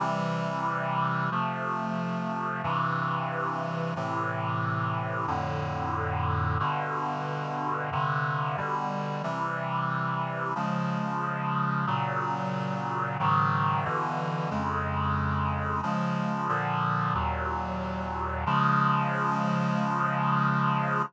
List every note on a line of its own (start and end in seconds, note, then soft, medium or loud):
0.00 1.30 C3 medium
0.00 1.30 E3 medium
0.00 1.30 G3 medium
1.31 2.62 C3 medium
1.31 2.62 F3 medium
1.31 2.62 A3 medium
2.63 3.94 G2 medium
2.63 3.94 C3 medium
2.63 3.94 E3 medium
3.96 5.26 A2 medium
3.96 5.26 C3 medium
3.96 5.26 E3 medium
5.27 6.58 F2 medium
5.27 6.58 A2 medium
5.27 6.58 D3 medium
6.60 7.90 G2 medium
6.60 7.90 B2 medium
6.60 7.90 D3 medium
7.92 8.57 G2 medium
7.92 8.57 C3 medium
7.92 8.57 D3 medium
8.57 9.22 B2 medium
8.57 9.22 D3 medium
8.57 9.22 G3 medium
9.23 10.54 C3 medium
9.23 10.54 E3 medium
9.23 10.54 G3 medium
10.55 11.86 C#3 medium
10.55 11.86 F3 medium
10.55 11.86 G#3 medium
11.87 13.17 A#2 medium
11.87 13.17 C#3 medium
11.87 13.17 F#3 medium
13.19 13.85 G#2 medium
13.19 13.85 C#3 medium
13.19 13.85 D#3 medium
13.19 13.85 F#3 medium
13.85 14.50 G2 medium
13.85 14.50 B2 medium
13.85 14.50 D3 medium
13.85 14.50 E3 medium
14.51 15.81 F2 medium
14.51 15.81 C#3 medium
14.51 15.81 G#3 medium
15.83 16.48 C#3 medium
15.83 16.48 F3 medium
15.83 16.48 G#3 medium
16.48 17.14 A#2 medium
16.48 17.14 D3 medium
16.48 17.14 F3 medium
17.14 18.45 D#2 medium
17.14 18.45 A#2 medium
17.14 18.45 F#3 medium
18.46 21.02 C#3 loud
18.46 21.02 F3 medium
18.46 21.02 G#3 loud